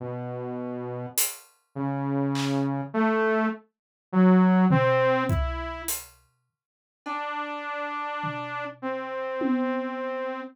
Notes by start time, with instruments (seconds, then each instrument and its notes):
0.00 lead 2 (sawtooth) B2
1.18 closed hi-hat
1.75 lead 2 (sawtooth) C#3
2.35 clap
2.94 lead 2 (sawtooth) A3
4.13 lead 2 (sawtooth) F#3
4.71 lead 2 (sawtooth) C4, floor tom
5.29 lead 2 (sawtooth) E4, kick
5.88 closed hi-hat
7.06 lead 2 (sawtooth) D4, cowbell
8.24 floor tom
8.82 lead 2 (sawtooth) C4
9.41 high tom